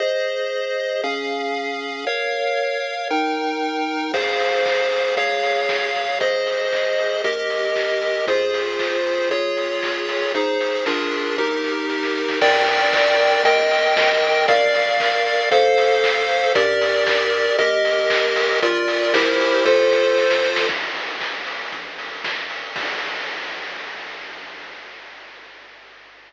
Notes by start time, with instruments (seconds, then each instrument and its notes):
0.00 lead 1 (square) G#4 C5 D#5
1.04 lead 1 (square) C#4 G#4 F5
2.07 lead 1 (square) A#4 C#5 F5
3.10 lead 1 (square) D#4 A#4 G5
4.13 synth bass 1 F2, lead 1 (square) G#4 C5 F5, kick, crash
4.40 open hi-hat
4.66 kick, clap
4.91 open hi-hat
5.16 synth bass 1 C#2, lead 1 (square) G#4 C#5 F5, kick, closed hi-hat
5.43 open hi-hat
5.69 kick, snare
5.94 synth bass 1 G#1, open hi-hat
6.20 lead 1 (square) G#4 C5 D#5, kick, closed hi-hat
6.47 open hi-hat
6.73 kick, clap
6.98 open hi-hat
7.24 synth bass 1 D#2, lead 1 (square) G4 A#4 D#5, kick, closed hi-hat
7.50 open hi-hat
7.76 kick, clap
8.02 open hi-hat
8.27 synth bass 1 F2, lead 1 (square) F4 G#4 C5, kick, closed hi-hat
8.54 open hi-hat
8.79 kick, clap
9.05 open hi-hat
9.30 synth bass 1 C#2, lead 1 (square) F4 G#4 C#5, kick, closed hi-hat
9.57 open hi-hat
9.83 kick, clap
10.09 open hi-hat
10.34 synth bass 1 G#1, lead 1 (square) D#4 G#4 C5, kick, closed hi-hat
10.60 open hi-hat
10.86 synth bass 1 A#1, lead 1 (square) D4 F4 G#4 A#4, kick, snare
11.12 open hi-hat
11.38 synth bass 1 D#2, lead 1 (square) D#4 G4 A#4, kick, snare
11.64 snare
11.90 snare
12.03 snare
12.15 snare
12.28 snare
12.41 synth bass 1 G2, lead 1 (square) A#4 D5 G5, kick, crash
12.67 open hi-hat
12.93 kick, clap
13.19 open hi-hat
13.44 synth bass 1 D#2, lead 1 (square) A#4 D#5 G5, kick, closed hi-hat
13.71 open hi-hat
13.97 kick, snare
14.21 synth bass 1 A#1, open hi-hat
14.48 lead 1 (square) A#4 D5 F5, kick, closed hi-hat
14.74 open hi-hat
15.00 kick, clap
15.26 open hi-hat
15.51 synth bass 1 F2, lead 1 (square) A4 C5 F5, kick, closed hi-hat
15.78 open hi-hat
16.04 kick, clap
16.29 open hi-hat
16.55 synth bass 1 G2, lead 1 (square) G4 A#4 D5, kick, closed hi-hat
16.81 open hi-hat
17.07 kick, clap
17.33 open hi-hat
17.58 synth bass 1 D#2, lead 1 (square) G4 A#4 D#5, kick, closed hi-hat
17.85 open hi-hat
18.10 kick, clap
18.36 open hi-hat
18.62 synth bass 1 A#1, lead 1 (square) F4 A#4 D5, kick, closed hi-hat
18.88 open hi-hat
19.14 synth bass 1 C2, lead 1 (square) E4 G4 A#4 C5, kick, snare
19.40 open hi-hat
19.65 synth bass 1 F2, lead 1 (square) F4 A4 C5, kick, snare
19.91 snare
20.17 snare
20.30 snare
20.43 snare
20.56 snare
20.69 synth bass 1 A#1, kick, crash
20.95 open hi-hat
21.21 kick, clap
21.46 open hi-hat
21.72 synth bass 1 A#1, kick, closed hi-hat
21.98 open hi-hat
22.24 kick, snare
22.50 open hi-hat
22.76 synth bass 1 A#1, kick, crash